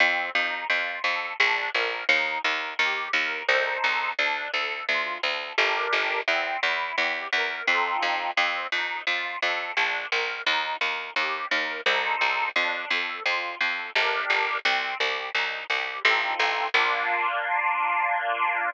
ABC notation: X:1
M:3/4
L:1/8
Q:1/4=86
K:Bb
V:1 name="Accordion"
C E F A D B | E B G B [EAc]2 | D A F A [DGB]2 | C =E G B [C_EFA]2 |
C E F A D B | E B G B [EAc]2 | D A F A [DGB]2 | C G E G [CEFA]2 |
[B,DF]6 |]
V:2 name="Harpsichord" clef=bass
F,, F,, F,, F,, B,,, B,,, | E,, E,, E,, E,, C,, C,, | D,, D,, D,, D,, G,,, G,,, | =E,, E,, E,, E,, F,, F,, |
F,, F,, F,, F,, B,,, B,,, | E,, E,, E,, E,, C,, C,, | F,, F,, F,, F,, G,,, G,,, | C,, C,, C,, C,, A,,, A,,, |
B,,,6 |]